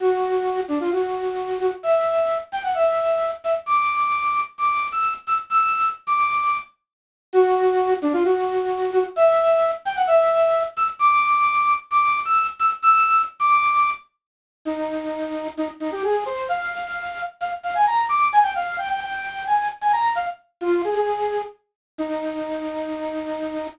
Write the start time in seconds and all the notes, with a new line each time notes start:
0.00 F#4
0.68 D4
0.80 F4
0.92 F#4
1.60 F#4
1.83 E5
2.52 G5
2.63 F#5
2.75 E5
3.44 E5
3.66 D6
4.58 D6
4.92 E6
5.27 E6
5.50 E6
6.07 D6
7.33 F#4
8.02 D4
8.13 F4
8.24 F#4
8.93 F#4
9.16 E5
9.85 G5
9.96 F#5
10.07 E5
10.77 E6
10.99 D6
11.91 D6
12.25 E6
12.59 E6
12.82 E6
13.40 D6
14.65 D#4
15.57 D#4
15.80 D#4
15.92 G4
16.04 G#4
16.26 C5
16.49 F5
17.40 F5
17.63 F5
17.75 G#5
17.87 A#5
18.09 D6
18.33 G#5
18.43 G5
18.55 F5
18.78 G5
18.89 G5
19.01 G5
19.47 G#5
19.81 G#5
19.93 A#5
20.15 F5
20.61 F4
20.84 G#4
20.95 G#4
21.98 D#4